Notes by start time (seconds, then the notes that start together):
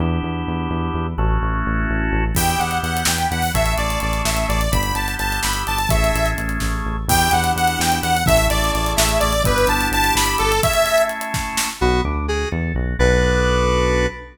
0.00 E2 B3 D4 E4 G4
0.23 E2
0.47 E2
0.70 E2
0.94 E2
1.18 A1 A3 C#4 E4 F#4
1.43 A1
1.66 A1
1.90 A1
2.12 A1
2.35 E2 B3 D4 E4 G4 G5, kick, crash
2.50 closed hi-hat
2.59 E2 F#5, closed hi-hat
2.71 closed hi-hat
2.83 E2 F#5, closed hi-hat
2.97 closed hi-hat
3.05 E2 G5, snare
3.18 closed hi-hat
3.31 E2 F#5, closed hi-hat
3.42 open hi-hat
3.54 A1 A3 C#4 E4 G#4 E5, kick, closed hi-hat
3.66 closed hi-hat
3.77 A1 D5, closed hi-hat
3.90 closed hi-hat
4.00 A1 D5, closed hi-hat
4.13 closed hi-hat
4.25 A1 E5, snare
4.37 closed hi-hat
4.48 A1 D5, closed hi-hat
4.61 closed hi-hat
4.72 G1 B3 D4 E4 G4 B5, kick, closed hi-hat
4.83 closed hi-hat
4.95 G1 A5, closed hi-hat
5.08 closed hi-hat
5.19 G1 A5, closed hi-hat
5.32 closed hi-hat
5.43 G1 B5, snare
5.53 closed hi-hat
5.67 G1 A5, closed hi-hat
5.78 closed hi-hat
5.89 A1 A3 C#4 E4 G#4 E5, kick, closed hi-hat
6.04 closed hi-hat
6.14 A1, closed hi-hat
6.26 closed hi-hat
6.38 A1, closed hi-hat
6.49 closed hi-hat
6.60 A1, kick, snare
6.85 A1
7.08 E2 B3 D4 E4 G4 G5, kick, crash
7.21 closed hi-hat
7.31 E2 F#5, closed hi-hat
7.44 closed hi-hat
7.56 E2 F#5, closed hi-hat
7.67 closed hi-hat
7.79 E2 G5, snare
7.92 closed hi-hat
8.02 E2 F#5, closed hi-hat
8.17 closed hi-hat
8.26 A1 A3 C#4 E4 G#4 E5, kick, closed hi-hat
8.37 closed hi-hat
8.50 A1 D5, closed hi-hat
8.64 closed hi-hat
8.73 A1 D5, closed hi-hat
8.86 closed hi-hat
8.96 A1 E5, snare
9.09 closed hi-hat
9.20 A1 D5, closed hi-hat
9.33 closed hi-hat
9.44 G1 B3 D4 E4 G4 B4, kick, closed hi-hat
9.58 closed hi-hat
9.67 G1 A5, closed hi-hat
9.81 closed hi-hat
9.91 G1 A5, closed hi-hat
10.04 closed hi-hat
10.15 G1 B5, snare
10.26 closed hi-hat
10.38 G1 A4, closed hi-hat
10.52 closed hi-hat
10.63 A3 C#4 E4 G#4 E5, kick, closed hi-hat
10.74 closed hi-hat
10.86 closed hi-hat
10.98 closed hi-hat
11.09 closed hi-hat
11.21 closed hi-hat
11.34 kick, snare
11.57 snare
11.81 B1 B3 F#4
12.05 D2 D4
12.28 F#4 G#4
12.52 E2 A4
12.75 B1 F#4
12.99 B1 B3 D4 F#4 A4 B4